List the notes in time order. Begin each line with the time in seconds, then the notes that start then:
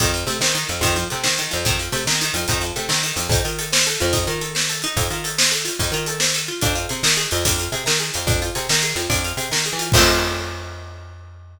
0.00 F2 D#3, kick, closed hi-hat
0.14 F3, closed hi-hat
0.27 C3 A3, closed hi-hat
0.41 D#3 C4, snare
0.55 D#3, closed hi-hat
0.69 F2 F3, closed hi-hat
0.81 F2 D#3, kick, closed hi-hat
0.96 F3, closed hi-hat
1.10 C3 A3, closed hi-hat
1.24 D#3 C4, snare
1.38 D#3, closed hi-hat
1.51 F2 F3, closed hi-hat
1.65 F2 D#3, kick, closed hi-hat
1.79 F3, closed hi-hat
1.92 C3 A3, closed hi-hat
2.07 D#3 C4, snare
2.21 D#3, closed hi-hat
2.34 F2 F3, closed hi-hat
2.48 F2 D#3, kick, closed hi-hat
2.61 F3, closed hi-hat
2.76 C3 A3, closed hi-hat
2.89 D#3 C4, snare
3.03 D#3, closed hi-hat
3.16 F2 F3, closed hi-hat
3.29 F2 D#4, kick, closed hi-hat
3.45 D#3 F4, closed hi-hat
3.59 A4, closed hi-hat
3.73 C5, snare
3.86 A4, closed hi-hat
4.00 F2 F4, closed hi-hat
4.13 D#4, kick, closed hi-hat
4.27 D#3 F4, closed hi-hat
4.41 A4, closed hi-hat
4.55 C5, snare
4.69 A4, closed hi-hat
4.82 D#4, closed hi-hat
4.97 F2, kick, closed hi-hat
5.10 D#3 F4, closed hi-hat
5.24 A4, closed hi-hat
5.38 C5, snare
5.52 A4, closed hi-hat
5.65 F4, closed hi-hat
5.79 F2 D#4, kick, closed hi-hat
5.92 D#3 F4, closed hi-hat
6.06 A4, closed hi-hat
6.20 C5, snare
6.34 A4, closed hi-hat
6.48 F4
6.61 F2 D4, kick, closed hi-hat
6.75 F4, closed hi-hat
6.89 C3 G#4, closed hi-hat
7.03 D#3 A#4, snare
7.17 G#4, closed hi-hat
7.31 F2 F4, closed hi-hat
7.45 F2 D4, kick, closed hi-hat
7.58 F4, closed hi-hat
7.72 C3 G#4, closed hi-hat
7.86 D#3 A#4, snare
7.99 G#4, closed hi-hat
8.14 F2 F4, closed hi-hat
8.27 F2 D4, kick, closed hi-hat
8.42 F4, closed hi-hat
8.55 C3 G#4, closed hi-hat
8.69 D#3 A#4, snare
8.82 G#4, closed hi-hat
8.96 F2 F4, closed hi-hat
9.10 F2 D4, kick, closed hi-hat
9.24 F4, closed hi-hat
9.37 C3 G#4, closed hi-hat
9.51 D#3 A#4, snare
9.65 G#4, closed hi-hat
9.73 E3
9.79 F4, closed hi-hat
9.92 F2 D#3 F3, kick, crash
9.96 A3 C4